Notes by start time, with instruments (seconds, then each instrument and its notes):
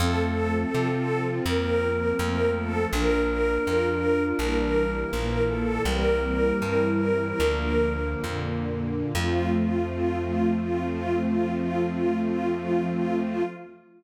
0.00 electric bass (finger) F2, string ensemble 1 F3 A3 C4 A4, flute C4
0.74 electric bass (finger) C3, string ensemble 1 F3 C4 F4
1.46 electric bass (finger) F2, string ensemble 1 F3 A#3 C4 A#4
2.18 electric bass (finger) F2, string ensemble 1 F3 A3 C4 A#4, flute A#3
2.55 string ensemble 1 A4
2.92 electric bass (finger) A#1, string ensemble 1 F3 A#3 D4 A#4, flute D4
3.65 electric bass (finger) F2, string ensemble 1 F3 D4 F4
4.39 electric bass (finger) A#1, string ensemble 1 E3 G3 A#3 A#4
5.11 electric bass (finger) A#1, string ensemble 1 A#2 E3 A#3 A#4, flute A#3
5.49 string ensemble 1 A4
5.84 electric bass (finger) C2, string ensemble 1 E3 G3 A#3 C4 A#4, flute G3
6.61 electric bass (finger) G2, string ensemble 1 E3 G3 C4 E4
7.39 electric bass (finger) D2, string ensemble 1 D3 F3 A#3
8.24 electric bass (finger) F2, string ensemble 1 A#2 D3 A#3
9.14 electric bass (finger) F2, string ensemble 1 F3 A3 C4 F4, flute F3